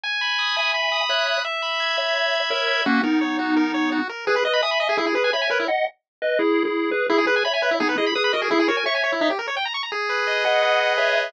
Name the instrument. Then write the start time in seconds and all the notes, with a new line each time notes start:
lead 1 (square)
0.04 G#5
0.21 B5
0.39 D#6
0.56 E5 G#5
0.74 B5
0.92 D#6
1.09 C#5 E5 F#6
1.27 B5
1.45 E5
1.62 B5
1.80 G#6
1.97 C#5 E5
2.15 B5
2.33 G#6
2.50 A#4 C#5 E5
2.68 B5
2.86 A#3 C#4 F#4
3.03 B3 D#4 A#4
3.21 C#5
3.39 F#4
3.56 A#4
3.74 C#5
3.92 F#4
4.09 A#4
4.27 G#4 B4
4.36 B4
4.45 B4 D#5
4.53 B5
4.62 E5 G#5 D#6
4.71 B5
4.80 D#5
4.89 G#4
4.97 E4 G#4
5.06 G#4
5.15 G#4 B4
5.24 G#5
5.33 C#5 E5 B5
5.42 G#5
5.50 A#4 B4 C#5
5.60 E4
5.68 D#5 F#5
6.22 B4 D#5
6.39 E4 G#4
6.65 E4 G#4
6.91 G#4 B4
7.09 E4 G#4
7.18 G#4
7.27 G#4 B4
7.36 G#5
7.45 C#5 E5 B5
7.54 G#5
7.62 B4
7.71 E4
7.80 B3 D#4 G#4
7.89 B4
7.98 E4 G#4 D#5
8.06 B5
8.15 G#4 B4 D#6
8.24 B5
8.33 F#4 A#4 D#5
8.42 G#4
8.51 E4 G#4
8.59 G#4
8.68 F#4 A#4 C#5
8.77 G#5
8.86 C#5 E5 C#6
8.95 G#5
9.04 C#5
9.12 E4
9.21 D#4
9.30 G4
9.39 A#4
9.48 C#5
9.57 G5
9.65 A#5
9.74 C#6
9.83 A#5
9.92 G#4
10.09 B4
10.27 D#5
10.45 G#4 D#5 F#5
10.62 B4
10.80 D#5
10.98 G#4 C#5 E5
11.15 B4